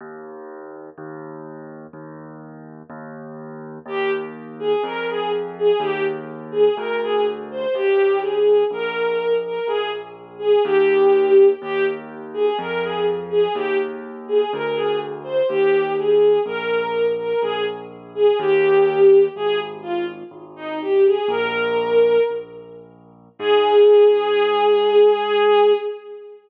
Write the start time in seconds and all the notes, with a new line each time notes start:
0.01 D#2
0.98 D#2
1.93 D#2
2.90 D#2
3.86 D#2 G4
4.59 G#4
4.83 F2 A#4
5.08 G#4
5.58 G#4
5.80 D#2 G4
6.51 G#4
6.77 D2 A#4
7.03 G#4
7.51 C5
7.74 D#2 G4
8.21 G#4
8.71 A#1 A#4
9.45 A#4
9.67 A#1 G#4
10.39 G#4
10.64 D#2 G4
11.61 D#2 G4
12.34 G#4
12.59 F2 A#4
12.82 G#4
13.30 G#4
13.54 D#2 G4
14.28 G#4
14.53 D2 A#4
14.75 G#4
15.24 C5
15.48 D#2 G4
15.97 G#4
16.45 A#1 A#4
17.18 A#4
17.41 A#1 G#4
18.15 G#4
18.39 D#2 G4
19.35 G#1 G#4
19.82 F4
20.31 G#1
20.56 D#4
20.81 G4
21.06 G#4
21.28 A#1 A#4
22.30 A#1
23.39 G#2 G#4